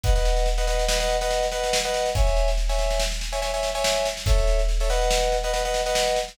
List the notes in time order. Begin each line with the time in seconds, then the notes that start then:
0.03 B4 D#5 F#5, kick, snare
0.15 B4 D#5 F#5, snare
0.25 snare
0.36 snare
0.46 snare
0.58 B4 D#5 F#5, snare
0.67 B4 D#5 F#5, snare
0.79 snare
0.88 B4 D#5 F#5, snare
1.00 B4 D#5 F#5, snare
1.10 snare
1.21 B4 D#5 F#5, snare
1.31 snare
1.43 snare
1.51 B4 D#5 F#5, snare
1.63 snare
1.73 snare
1.85 B4 D#5 F#5, snare
1.94 snare
2.06 snare
2.15 C#5 E5 G#5, kick, snare
2.27 snare
2.36 snare
2.48 snare
2.57 snare
2.69 C#5 E5 G#5, snare
2.79 snare
2.90 snare
2.99 snare
3.11 snare
3.21 snare
3.32 C#5 E5 G#5, snare
3.42 C#5 E5 G#5, snare
3.53 C#5 E5 G#5, snare
3.63 snare
3.75 C#5 E5 G#5, snare
3.84 snare
3.96 snare
4.05 snare
4.17 snare
4.26 A4 C#5 E5, kick, snare
4.38 snare
4.47 snare
4.59 snare
4.69 snare
4.80 A4 C#5 E5, snare
4.90 B4 D#5 F#5, snare
5.01 snare
5.11 snare
5.22 snare
5.32 snare
5.43 B4 D#5 F#5, snare
5.53 B4 D#5 F#5, snare
5.65 B4 D#5 F#5, snare
5.74 snare
5.86 B4 D#5 F#5, snare
5.95 snare
6.07 snare
6.16 snare
6.28 snare